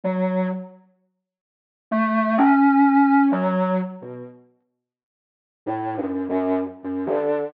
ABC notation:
X:1
M:4/4
L:1/16
Q:1/4=64
K:none
V:1 name="Ocarina"
_G,2 z6 A,2 _D4 G,2 | z B,, z6 (3A,,2 _G,,2 G,,2 z G,, D,2 |]